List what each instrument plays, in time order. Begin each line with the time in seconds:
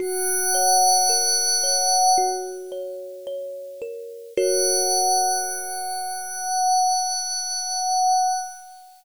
0.00 kalimba F#4, pad 5 (bowed) F#5
0.55 kalimba C#5
1.09 kalimba A#4
1.63 kalimba C#5
2.18 kalimba F#4
2.72 kalimba C#5
3.27 kalimba C#5
3.82 kalimba A#4
4.36 kalimba F#4 A#4 C#5, pad 5 (bowed) F#5